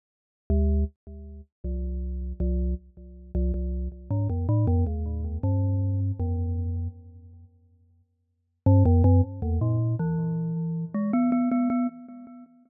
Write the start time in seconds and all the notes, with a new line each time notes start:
0.50 D2
1.64 C2
2.40 C2
3.35 C2
3.54 C2
4.10 G#2
4.29 F2
4.49 A2
4.67 F2
4.87 D#2
5.43 G2
6.19 F2
8.66 G2
8.85 F2
9.04 F#2
9.42 E2
9.61 A#2
9.99 E3
10.94 G#3
11.13 B3
11.32 B3
11.51 B3
11.70 B3